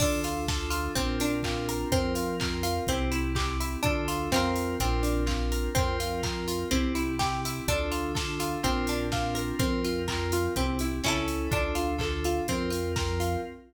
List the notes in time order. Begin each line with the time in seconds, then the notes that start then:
0.00 D2 D4 F4 A4, kick, crash
0.24 F4, open hi-hat
0.48 D4 F4 A4, kick, snare
0.70 F4, open hi-hat
0.95 A#1 C4 D4 F4 A#4, kick, closed hi-hat
1.20 D4, open hi-hat
1.43 C4 D4 F4 A#4, kick, clap
1.69 A#4, open hi-hat
1.92 F2 C4 F4 A#4, kick, closed hi-hat
2.15 F4, open hi-hat
2.40 C4 F4 A#4, kick, clap
2.63 F4, open hi-hat
2.87 C2 C4 E4 G4, kick, closed hi-hat
3.12 E4, open hi-hat
3.35 C4 E4 G4, kick, clap
3.60 E4, open hi-hat
3.83 D2 D4 F4 A4, kick, closed hi-hat
4.08 F4, open hi-hat
4.32 F2 C4 F4 A#4, kick, snare
4.36 A#4
4.56 open hi-hat
4.80 A#1 C4 D4 F4 A#4, kick, closed hi-hat
5.03 D4, open hi-hat
5.26 C4 D4 F4 A#4, kick, clap
5.52 A#4, open hi-hat
5.75 F2 C4 F4 A#4, kick, closed hi-hat
6.00 F4, open hi-hat
6.23 C4 F4 A#4, kick, clap
6.48 F4, open hi-hat
6.71 C2 C4 E4 G4, kick, closed hi-hat
6.95 E4, open hi-hat
7.19 C4 E4 G4, kick, snare
7.45 E4, open hi-hat
7.68 D2 D4 F4 A4, kick, closed hi-hat
7.92 F4, open hi-hat
8.14 D4 F4 A4, kick, snare
8.40 F4, open hi-hat
8.63 A#1 C4 D4 F4 A#4, kick, closed hi-hat
8.87 D4, open hi-hat
9.12 C4 D4 F4 A#4, kick, snare
9.35 A#4, open hi-hat
9.59 F2 C4 F4 A#4, kick, closed hi-hat
9.84 F4, open hi-hat
10.08 C4 F4 A#4, kick, clap
10.32 F4, open hi-hat
10.56 C2 C4 E4 G4, kick, closed hi-hat
10.79 E4, open hi-hat
11.04 C#2 C#4 E4 A4, kick, snare
11.08 A4
11.28 open hi-hat
11.51 D2 D4 F4 A4, kick, closed hi-hat
11.75 F4, open hi-hat
11.98 D4 F4 A4, kick, clap
12.24 F4, open hi-hat
12.48 F2 C4 F4 A#4, kick, closed hi-hat
12.70 F4, open hi-hat
12.96 C4 F4 A#4, kick, snare
13.20 F4, open hi-hat